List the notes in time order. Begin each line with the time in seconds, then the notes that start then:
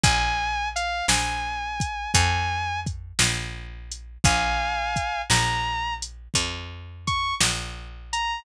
0.04 A#1 G#5, kick, closed hi-hat
0.76 F5, closed hi-hat
1.08 A#1 G#5, snare
1.80 kick, closed hi-hat
2.14 F2 G#5, kick, closed hi-hat
2.86 kick, closed hi-hat
3.19 A#1, snare
3.91 closed hi-hat
4.24 A#1 F5 G#5, kick, closed hi-hat
4.96 kick, closed hi-hat
5.30 A#1 A#5, snare
6.02 closed hi-hat
6.34 F2, kick, closed hi-hat
7.07 C#6, kick, closed hi-hat
7.40 A#1, snare
8.13 A#5, closed hi-hat